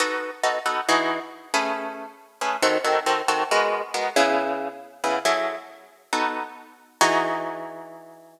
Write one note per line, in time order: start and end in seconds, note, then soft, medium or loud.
0.00 0.30 B3 medium
0.00 0.30 D#4 medium
0.00 0.30 F#4 medium
0.00 0.30 A4 medium
0.43 0.59 B3 medium
0.43 0.59 D#4 medium
0.43 0.59 F#4 medium
0.43 0.59 A4 medium
0.66 0.81 B3 medium
0.66 0.81 D#4 medium
0.66 0.81 F#4 medium
0.66 0.81 A4 medium
0.89 1.19 E3 medium
0.89 1.19 D#4 medium
0.89 1.19 F#4 medium
0.89 1.19 G#4 medium
1.54 2.06 A3 medium
1.54 2.06 C#4 medium
1.54 2.06 G#4 medium
1.54 2.06 B4 medium
2.41 2.57 A3 medium
2.41 2.57 C#4 medium
2.41 2.57 G#4 medium
2.41 2.57 B4 medium
2.62 2.78 D#3 medium
2.62 2.78 C4 medium
2.62 2.78 F#4 medium
2.62 2.78 A4 medium
2.84 3.00 D#3 medium
2.84 3.00 C4 medium
2.84 3.00 F#4 medium
2.84 3.00 A4 medium
3.06 3.22 D#3 medium
3.06 3.22 C4 medium
3.06 3.22 F#4 medium
3.06 3.22 A4 medium
3.28 3.44 D#3 medium
3.28 3.44 C4 medium
3.28 3.44 F#4 medium
3.28 3.44 A4 medium
3.51 3.82 G#3 medium
3.51 3.82 B3 medium
3.51 3.82 F#4 medium
3.51 3.82 A#4 medium
3.94 4.09 G#3 medium
3.94 4.09 B3 medium
3.94 4.09 F#4 medium
3.94 4.09 A#4 medium
4.16 4.69 C#3 medium
4.16 4.69 B3 medium
4.16 4.69 E4 medium
4.16 4.69 G#4 medium
5.04 5.19 C#3 medium
5.04 5.19 B3 medium
5.04 5.19 E4 medium
5.04 5.19 G#4 medium
5.25 5.56 F#3 medium
5.25 5.56 E4 medium
5.25 5.56 G#4 medium
5.25 5.56 A4 medium
6.13 6.43 B3 medium
6.13 6.43 D#4 medium
6.13 6.43 F#4 medium
6.13 6.43 A4 medium
7.01 8.40 E3 loud
7.01 8.40 D#4 loud
7.01 8.40 F#4 loud
7.01 8.40 G#4 loud